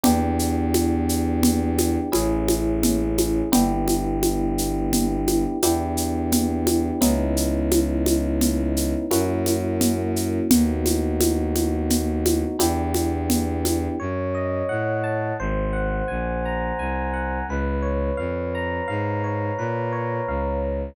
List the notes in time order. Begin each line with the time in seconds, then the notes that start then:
0.03 E2 B3 D4 E4 G4, low conga, shaker
0.39 shaker
0.74 high conga, shaker
1.09 shaker
1.43 low conga, shaker
1.78 high conga, shaker
2.12 A1 A3 C#4 E4 G#4, high conga, shaker
2.49 high conga, shaker
2.83 low conga, shaker
3.18 high conga, shaker
3.52 G1 B3 D4 E4 G4, low conga, shaker
3.88 high conga, shaker
4.23 high conga, shaker
4.58 shaker
4.93 low conga, shaker
5.28 high conga, shaker
5.62 E2 B3 D4 E4 G4, high conga, shaker
5.97 shaker
6.32 low conga, shaker
6.67 high conga, shaker
7.01 C#2 B3 C#4 D#4 E4, low conga, shaker
7.37 shaker
7.71 high conga, shaker
8.06 high conga, shaker
8.41 low conga, shaker
8.77 shaker
9.11 F#2 A#3 C#4 E4 F#4, high conga, shaker
9.46 high conga, shaker
9.81 low conga, shaker
10.16 shaker
10.51 D#2 A3 B3 D#4 F#4, low conga, shaker
10.86 high conga, shaker
11.20 high conga, shaker
11.56 high conga, shaker
11.90 low conga, shaker
12.26 high conga, shaker
12.59 E2 B3 D4 E4 G4, high conga, shaker
12.94 high conga, shaker
13.30 low conga, shaker
13.65 high conga, shaker
14.00 F#2 C#5
14.35 D#5
14.69 A2 F#5
15.04 A5
15.39 G#1 C5
15.73 F#5
16.08 A#1 G#5
16.45 A#5
16.79 C2 G#5
17.14 F#5
17.48 C#2 B4
17.82 C#5
18.17 F2 F5
18.55 A#5
18.88 G#2 F5
19.24 C#5
19.58 A#2 B4
19.92 C#5
20.28 C#2 F5
20.62 A#5